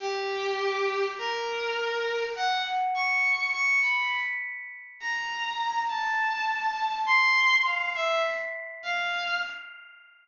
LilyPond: \new Staff { \time 6/8 \tempo 4. = 34 g'4 bes'4 ges''16 r16 des'''8 | des'''16 b''16 r8. bes''8. a''4 | c'''8 f''16 e''16 r8 f''8 r4 | }